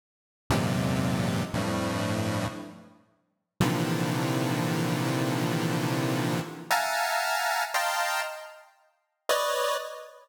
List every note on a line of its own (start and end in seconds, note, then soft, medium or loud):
0.50 1.43 E2 loud
0.50 1.43 F#2 loud
0.50 1.43 G#2 loud
0.50 1.43 A#2 loud
0.50 1.43 C3 loud
1.53 2.47 F2 medium
1.53 2.47 G2 medium
1.53 2.47 A2 medium
3.60 6.40 A#2 loud
3.60 6.40 C3 loud
3.60 6.40 D3 loud
3.60 6.40 D#3 loud
3.60 6.40 E3 loud
3.60 6.40 F3 loud
6.70 7.64 E5 medium
6.70 7.64 F5 medium
6.70 7.64 F#5 medium
6.70 7.64 G#5 medium
6.70 7.64 A5 medium
6.70 7.64 A#5 medium
7.74 8.21 D#5 medium
7.74 8.21 F5 medium
7.74 8.21 G5 medium
7.74 8.21 A5 medium
7.74 8.21 A#5 medium
7.74 8.21 C6 medium
9.29 9.76 B4 medium
9.29 9.76 C#5 medium
9.29 9.76 D5 medium
9.29 9.76 D#5 medium